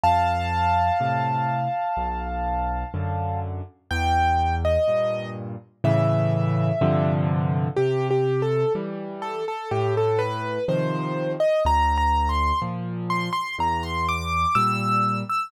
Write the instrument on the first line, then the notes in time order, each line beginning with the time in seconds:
acoustic grand piano
0.03 F2 F5 A5
1.00 A2 C3
1.97 B1
2.94 F#2 D3
3.91 E2 G5
4.65 D#5
4.88 G2 A#2
5.84 A2 C#3 E3 E5
6.81 G2 C3 D3 F3
7.76 C3 G4
8.10 G4
8.42 A4
8.75 E3 G3
9.22 A4
9.48 A4
9.71 A2 G4
9.97 A4
10.19 B4
10.68 C3 D#3 F3 C5
11.40 D#5
11.65 D2 A#5
11.98 A#5
12.29 C6
12.62 A#2 F3
13.10 C6
13.33 C6
13.58 E2 A#5
13.83 C6
14.08 D6
14.55 A#2 G3 E6
15.29 E6